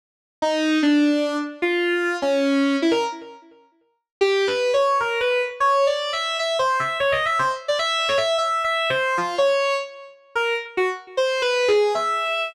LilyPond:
\new Staff { \time 7/8 \tempo 4 = 151 r4 ees'4 d'4. | r8 f'4. des'4. | e'16 bes'16 r2. | \tuplet 3/2 { g'4 b'4 des''4 } bes'8 b'8 r8 |
\tuplet 3/2 { des''4 d''4 e''4 } e''8 c''8 e''8 | \tuplet 3/2 { des''8 ees''8 e''8 } c''16 r8 d''16 e''8. des''16 e''8 | \tuplet 3/2 { e''4 e''4 c''4 } f'8 des''4 | r4. bes'8 r8 ges'16 r8. |
\tuplet 3/2 { c''4 b'4 aes'4 } e''4. | }